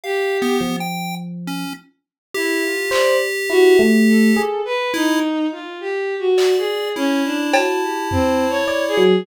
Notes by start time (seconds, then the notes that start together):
0.04 G4 F5
0.42 B3
0.61 F3
0.80 G5
1.47 C#4
2.35 E4 G4
2.63 F4
2.91 C5 D5, clap
3.50 E4 F#4
3.79 A3
4.07 A4
4.37 G#4
4.65 B4
4.94 D#4 E4
5.52 F4
5.81 G4
6.19 F#4
6.38 D5, clap
6.58 G#4
6.96 C#4 E4
7.25 D4
7.54 F#4 A5, cowbell
7.82 G4
8.11 C4, floor tom
8.50 C#5
8.68 D5
8.88 G#4
8.97 F#3